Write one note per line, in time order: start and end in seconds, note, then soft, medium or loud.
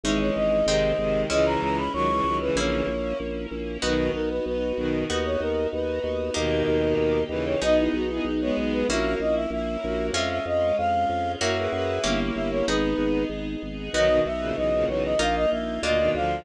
0.04 0.31 G#1 loud
0.04 0.61 E3 medium
0.04 0.61 G#3 medium
0.04 0.67 G#3 medium
0.04 0.67 C#4 loud
0.04 0.67 C#4 medium
0.04 0.67 D#4 loud
0.04 0.67 D#4 medium
0.04 0.19 E5 medium
0.20 0.35 C#5 medium
0.35 0.63 G#1 medium
0.35 0.66 D#5 medium
0.66 0.93 G#1 loud
0.66 0.93 C3 medium
0.66 0.93 D#3 loud
0.66 1.30 G#3 medium
0.66 1.29 G#3 medium
0.66 1.30 C4 medium
0.66 1.30 D#4 medium
0.66 1.22 D#5 medium
0.98 1.25 G#1 medium
0.98 1.27 C3 medium
0.98 1.27 D#3 loud
1.30 1.57 C#2 loud
1.30 1.82 C#3 loud
1.30 1.82 E3 loud
1.30 2.54 G#3 medium
1.30 2.55 G#3 medium
1.30 2.54 C#4 medium
1.30 2.55 C#4 loud
1.30 2.54 E4 medium
1.30 2.55 E4 loud
1.30 1.45 D#5 loud
1.46 1.61 A#5 medium
1.62 1.89 C#2 medium
1.62 1.77 A#5 medium
1.78 1.93 B5 medium
1.93 2.21 C#2 loud
1.93 2.08 D#3 loud
1.93 2.08 F#3 loud
1.93 2.37 C#6 loud
2.10 2.25 C#3 medium
2.10 2.25 E3 loud
2.24 2.51 C#2 loud
2.24 2.39 D#3 medium
2.24 2.39 F#3 medium
2.41 2.87 C#3 loud
2.41 2.87 E3 loud
2.41 2.56 B4 loud
2.55 2.82 A#1 loud
2.55 3.82 A#3 medium
2.55 3.81 A#3 medium
2.55 3.82 C#4 loud
2.55 3.81 C#4 medium
2.55 3.82 E4 medium
2.55 3.81 E4 medium
2.55 3.17 C#5 medium
2.87 3.14 A#1 loud
3.20 3.47 A#1 medium
3.51 3.78 A#1 medium
3.82 4.10 B1 loud
3.82 4.11 B2 loud
3.82 4.11 D#3 loud
3.82 5.06 B3 medium
3.82 5.08 B3 medium
3.82 5.06 D#4 medium
3.82 5.08 D#4 medium
3.82 5.06 F#4 medium
3.82 5.08 F#4 medium
3.82 4.10 B4 loud
4.13 4.40 B1 medium
4.13 4.29 A#4 medium
4.30 4.45 B4 medium
4.46 4.73 B1 medium
4.46 4.98 B4 medium
4.77 5.04 B1 medium
4.77 5.05 B2 medium
4.77 5.05 D#3 loud
5.09 5.37 D#2 loud
5.09 6.34 B3 medium
5.09 6.34 D#4 medium
5.09 6.34 F#4 medium
5.09 5.24 B4 medium
5.25 5.40 C#5 medium
5.40 5.67 D#2 loud
5.40 5.69 A#4 loud
5.73 6.00 D#2 medium
5.73 6.34 B4 medium
6.04 6.31 D#2 loud
6.34 6.63 D#2 loud
6.34 7.19 B2 loud
6.34 7.19 D#3 loud
6.34 7.58 A#3 medium
6.34 7.60 A#3 medium
6.34 7.58 D#4 medium
6.34 7.60 D#4 medium
6.34 7.58 G4 medium
6.34 7.60 G4 loud
6.34 7.23 A#4 loud
6.68 6.94 D#2 loud
6.97 7.24 D#2 loud
7.29 7.56 D#2 medium
7.29 7.56 C#3 medium
7.29 7.56 E3 loud
7.29 7.45 B4 medium
7.46 7.61 C#5 medium
7.61 7.89 B1 loud
7.61 8.04 B3 loud
7.61 8.86 B3 medium
7.61 8.85 B3 medium
7.61 8.04 D#4 loud
7.61 8.86 D#4 loud
7.61 8.85 D#4 medium
7.61 8.86 G#4 loud
7.61 8.85 G#4 medium
7.61 7.77 D#5 loud
7.78 7.93 E4 medium
7.93 8.20 B1 medium
7.93 8.09 F#4 medium
8.09 8.25 B3 medium
8.09 8.25 D#4 loud
8.09 8.24 E4 medium
8.24 8.51 B1 medium
8.24 8.40 D#4 medium
8.41 8.86 G#3 loud
8.41 8.86 B3 loud
8.41 8.56 C#5 medium
8.57 8.84 B1 medium
8.73 8.88 B4 medium
8.88 9.16 A#1 loud
8.88 10.13 A#3 medium
8.88 10.13 C#4 medium
8.88 10.13 E4 loud
8.88 10.13 E4 medium
8.88 9.18 F#4 loud
8.88 9.18 A#4 loud
8.88 9.14 E5 loud
9.20 9.47 A#1 medium
9.20 9.35 D#5 loud
9.35 9.50 E5 loud
9.50 9.77 A#1 loud
9.50 10.06 E5 medium
9.83 10.11 A#1 loud
9.83 10.12 F#4 medium
9.83 10.12 A#4 medium
10.13 10.40 F2 loud
10.13 11.38 G#3 medium
10.13 11.39 G#3 medium
10.13 11.38 C#4 medium
10.13 11.39 C#4 medium
10.13 11.38 F4 medium
10.13 11.39 F4 medium
10.13 10.29 E5 loud
10.30 10.45 E5 loud
10.46 10.72 F2 medium
10.46 10.76 D#5 loud
10.78 11.06 F2 medium
10.78 11.32 F5 loud
11.09 11.36 F2 medium
11.40 11.68 F#2 loud
11.40 12.03 A#3 medium
11.40 12.03 C#4 medium
11.40 12.03 E4 loud
11.40 12.03 E4 medium
11.40 11.55 F#4 loud
11.40 12.03 F#4 medium
11.40 11.55 A#4 loud
11.40 12.19 E5 loud
11.57 11.71 G#4 medium
11.57 11.71 B4 loud
11.72 11.99 F#2 loud
11.72 12.00 G#4 loud
11.72 12.00 B4 loud
12.04 12.31 G1 loud
12.04 12.65 A#3 medium
12.04 12.66 A#3 medium
12.04 12.67 A#3 loud
12.04 12.66 C#4 medium
12.04 12.67 C#4 medium
12.04 12.65 E4 loud
12.04 12.66 E4 medium
12.04 12.67 E4 medium
12.04 12.66 G4 medium
12.04 12.67 G4 medium
12.36 12.63 G1 medium
12.36 12.51 E5 medium
12.51 12.66 C#5 loud
12.67 12.94 G#1 loud
12.67 13.92 B3 medium
12.67 13.25 B3 medium
12.67 13.92 B3 medium
12.67 13.92 D#4 medium
12.67 13.25 D#4 medium
12.67 13.92 D#4 medium
12.67 13.92 G#4 loud
12.67 13.92 G#4 medium
12.67 13.23 B4 loud
12.98 13.25 G#1 loud
13.29 13.56 G#1 medium
13.63 13.89 G#1 medium
13.93 14.20 B1 loud
13.93 14.08 D#3 loud
13.93 14.09 F#3 loud
13.93 15.18 B3 loud
13.93 15.18 B3 medium
13.93 15.18 D#4 medium
13.93 15.18 F#4 medium
13.93 14.20 D#5 loud
14.08 14.23 B2 medium
14.08 14.23 D#3 loud
14.26 14.52 B1 medium
14.26 14.56 E5 loud
14.40 14.55 A#2 medium
14.40 14.55 C#3 medium
14.56 14.85 B1 loud
14.56 14.72 C#3 medium
14.56 14.72 E3 medium
14.56 14.85 D#5 loud
14.74 14.89 A#2 medium
14.74 14.88 C#3 loud
14.88 15.15 B1 medium
14.88 15.14 C#3 medium
14.88 15.14 E3 medium
14.88 15.03 C#5 medium
15.04 15.19 D#5 medium
15.19 15.46 A#1 loud
15.19 15.81 A#3 medium
15.19 15.82 A#3 medium
15.19 15.81 D#4 medium
15.19 15.83 D#4 medium
15.19 15.81 F4 medium
15.19 15.82 F4 medium
15.19 15.35 F5 loud
15.35 15.50 D#5 loud
15.51 15.79 A#1 medium
15.51 15.81 E5 medium
15.83 16.09 D2 loud
15.83 15.99 A#2 medium
15.83 15.99 D3 medium
15.83 16.45 A#3 medium
15.83 16.45 D4 medium
15.83 16.45 F4 medium
15.83 16.10 D#5 loud
15.99 16.14 B2 medium
15.99 16.14 D#3 loud
16.14 16.41 D2 loud
16.14 16.43 D3 medium
16.14 16.43 F3 loud
16.14 16.40 F5 loud